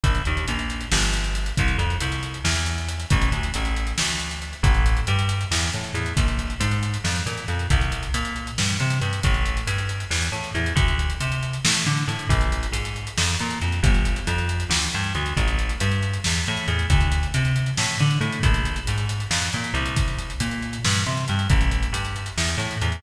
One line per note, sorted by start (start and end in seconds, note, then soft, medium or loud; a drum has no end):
0.04 0.22 A#1 loud
0.04 kick medium
0.04 closed hi-hat medium
0.15 closed hi-hat medium
0.25 0.46 D#2 medium
0.25 closed hi-hat medium
0.37 closed hi-hat medium
0.48 0.86 A#1 loud
0.48 closed hi-hat medium
0.59 closed hi-hat medium
0.70 closed hi-hat medium
0.81 closed hi-hat medium
0.92 1.52 G1 loud
0.92 snare loud
1.02 closed hi-hat medium
1.14 closed hi-hat medium
1.24 closed hi-hat medium
1.35 closed hi-hat medium
1.46 closed hi-hat medium
1.57 1.77 C2 loud
1.57 kick medium
1.57 closed hi-hat medium
1.68 closed hi-hat medium
1.78 1.97 F2 medium
1.78 closed hi-hat medium
1.90 closed hi-hat medium
2.01 2.38 C2 medium
2.01 closed hi-hat medium
2.12 closed hi-hat medium
2.23 closed hi-hat medium
2.34 closed hi-hat medium
2.44 3.05 E2 loud
2.44 snare medium
2.56 closed hi-hat medium
2.66 closed hi-hat medium
2.78 closed hi-hat medium
2.89 closed hi-hat medium
3.00 closed hi-hat medium
3.10 3.30 A1 loud
3.10 kick loud
3.10 closed hi-hat medium
3.22 closed hi-hat medium
3.32 3.50 D2 medium
3.32 closed hi-hat medium
3.43 closed hi-hat medium
3.54 3.93 A1 medium
3.54 closed hi-hat medium
3.65 closed hi-hat medium
3.76 closed hi-hat medium
3.87 closed hi-hat medium
3.98 4.54 D2 medium
3.98 snare loud
4.09 closed hi-hat medium
4.20 closed hi-hat medium
4.31 closed hi-hat medium
4.42 closed hi-hat medium
4.53 closed hi-hat medium
4.63 5.00 A1 loud
4.63 kick loud
4.63 closed hi-hat medium
4.74 closed hi-hat medium
4.86 closed hi-hat medium
4.97 closed hi-hat medium
5.07 5.45 G2 loud
5.07 closed hi-hat medium
5.19 closed hi-hat medium
5.29 closed hi-hat medium
5.41 closed hi-hat medium
5.51 5.70 E2 loud
5.51 snare medium
5.62 closed hi-hat medium
5.73 5.92 A2 medium
5.73 closed hi-hat medium
5.84 closed hi-hat medium
5.94 6.13 E2 loud
5.94 closed hi-hat medium
6.06 closed hi-hat medium
6.17 6.54 A#1 loud
6.17 kick medium
6.17 closed hi-hat medium
6.28 closed hi-hat medium
6.39 closed hi-hat medium
6.50 closed hi-hat medium
6.60 6.97 G#2 loud
6.60 closed hi-hat loud
6.71 closed hi-hat medium
6.83 closed hi-hat medium
6.94 closed hi-hat medium
7.04 7.23 F2 medium
7.04 snare medium
7.16 closed hi-hat medium
7.26 7.45 A#2 medium
7.26 closed hi-hat medium
7.37 closed hi-hat medium
7.48 7.67 F2 medium
7.48 closed hi-hat medium
7.59 closed hi-hat medium
7.70 8.08 C2 loud
7.70 kick medium
7.70 closed hi-hat medium
7.81 closed hi-hat medium
7.92 closed hi-hat medium
8.03 closed hi-hat medium
8.14 8.51 A#2 loud
8.14 closed hi-hat medium
8.25 closed hi-hat medium
8.36 closed hi-hat medium
8.47 closed hi-hat medium
8.58 8.77 G2 medium
8.58 snare medium
8.69 closed hi-hat medium
8.80 8.99 C3 loud
8.80 closed hi-hat medium
8.90 closed hi-hat medium
9.01 9.20 G2 medium
9.01 closed hi-hat medium
9.13 closed hi-hat medium
9.23 9.61 A1 loud
9.23 kick medium
9.23 closed hi-hat medium
9.34 closed hi-hat medium
9.46 closed hi-hat medium
9.57 closed hi-hat medium
9.67 10.04 G2 medium
9.67 closed hi-hat medium
9.78 closed hi-hat medium
9.89 closed hi-hat medium
10.00 closed hi-hat medium
10.11 10.29 E2 loud
10.11 snare medium
10.22 closed hi-hat medium
10.32 10.51 A2 loud
10.32 closed hi-hat medium
10.44 closed hi-hat medium
10.54 10.73 E2 medium
10.54 closed hi-hat medium
10.66 closed hi-hat medium
10.76 11.13 D2 loud
10.76 kick medium
10.76 closed hi-hat medium
10.88 closed hi-hat medium
10.99 closed hi-hat medium
11.10 closed hi-hat medium
11.21 11.58 C3 medium
11.21 closed hi-hat medium
11.32 closed hi-hat medium
11.43 closed hi-hat medium
11.53 closed hi-hat medium
11.65 11.84 A2 medium
11.65 snare loud
11.75 closed hi-hat medium
11.86 12.05 D3 medium
11.86 closed hi-hat medium
11.97 closed hi-hat medium
12.08 12.26 A2 loud
12.08 closed hi-hat medium
12.19 closed hi-hat medium
12.29 12.66 A#1 loud
12.29 kick medium
12.29 closed hi-hat medium
12.41 closed hi-hat medium
12.52 closed hi-hat medium
12.63 closed hi-hat medium
12.72 13.10 G#2 medium
12.72 closed hi-hat medium
12.85 closed hi-hat medium
12.96 closed hi-hat medium
13.07 closed hi-hat medium
13.18 13.36 F2 loud
13.18 snare loud
13.29 closed hi-hat medium
13.40 13.59 A#2 loud
13.40 closed hi-hat medium
13.51 closed hi-hat medium
13.62 13.80 F2 medium
13.62 closed hi-hat medium
13.72 closed hi-hat medium
13.83 14.20 G1 loud
13.83 kick loud
13.83 closed hi-hat medium
13.94 closed hi-hat medium
14.05 closed hi-hat medium
14.16 closed hi-hat medium
14.27 14.64 F2 loud
14.27 closed hi-hat medium
14.38 closed hi-hat medium
14.49 closed hi-hat medium
14.60 closed hi-hat medium
14.70 14.88 D2 medium
14.70 snare loud
14.82 closed hi-hat medium
14.93 15.13 G2 medium
14.93 closed hi-hat medium
15.04 closed hi-hat medium
15.15 15.34 D2 loud
15.15 closed hi-hat medium
15.26 closed hi-hat medium
15.37 15.74 A1 loud
15.37 kick medium
15.37 closed hi-hat medium
15.48 closed hi-hat medium
15.59 closed hi-hat medium
15.69 closed hi-hat medium
15.80 16.18 G2 loud
15.80 closed hi-hat medium
15.92 closed hi-hat medium
16.03 closed hi-hat medium
16.14 closed hi-hat medium
16.24 16.45 E2 medium
16.24 snare medium
16.35 closed hi-hat medium
16.46 16.66 A2 loud
16.46 closed hi-hat medium
16.57 closed hi-hat medium
16.68 16.86 E2 loud
16.68 closed hi-hat medium
16.79 closed hi-hat medium
16.90 17.27 D2 loud
16.90 kick medium
16.90 closed hi-hat medium
17.01 closed hi-hat medium
17.12 closed hi-hat medium
17.23 closed hi-hat medium
17.34 17.71 C3 loud
17.34 closed hi-hat medium
17.45 closed hi-hat medium
17.56 closed hi-hat medium
17.66 closed hi-hat medium
17.77 17.97 A2 loud
17.77 snare medium
17.88 closed hi-hat medium
18.00 18.19 D3 loud
18.00 closed hi-hat medium
18.11 closed hi-hat medium
18.21 18.39 A2 loud
18.21 closed hi-hat medium
18.32 closed hi-hat medium
18.43 18.80 A#1 loud
18.43 kick medium
18.43 closed hi-hat medium
18.54 closed hi-hat medium
18.65 closed hi-hat medium
18.76 closed hi-hat medium
18.87 19.25 G#2 medium
18.87 closed hi-hat medium
18.98 closed hi-hat medium
19.09 closed hi-hat medium
19.20 closed hi-hat medium
19.31 19.49 F2 medium
19.31 snare medium
19.42 closed hi-hat medium
19.53 19.72 A#2 medium
19.53 closed hi-hat medium
19.64 closed hi-hat medium
19.74 20.33 C2 loud
19.74 closed hi-hat medium
19.86 closed hi-hat medium
19.96 kick medium
19.96 closed hi-hat medium
20.08 closed hi-hat medium
20.19 closed hi-hat medium
20.30 closed hi-hat medium
20.40 20.78 A#2 loud
20.40 closed hi-hat medium
20.51 closed hi-hat medium
20.62 closed hi-hat medium
20.73 closed hi-hat medium
20.85 21.03 G2 loud
20.85 snare medium
20.95 closed hi-hat medium
21.06 21.25 C3 loud
21.06 closed hi-hat medium
21.17 closed hi-hat medium
21.28 21.48 G2 loud
21.28 closed hi-hat medium
21.39 closed hi-hat medium
21.50 21.87 A1 loud
21.50 kick loud
21.50 closed hi-hat medium
21.61 closed hi-hat medium
21.71 closed hi-hat medium
21.83 closed hi-hat medium
21.93 22.30 G2 medium
21.93 closed hi-hat medium
22.05 closed hi-hat medium
22.16 closed hi-hat medium
22.26 closed hi-hat medium
22.37 22.56 E2 loud
22.37 snare medium
22.49 closed hi-hat medium
22.58 22.76 A2 loud
22.58 closed hi-hat medium
22.71 closed hi-hat medium
22.81 23.00 E2 loud
22.81 closed hi-hat medium
22.92 closed hi-hat medium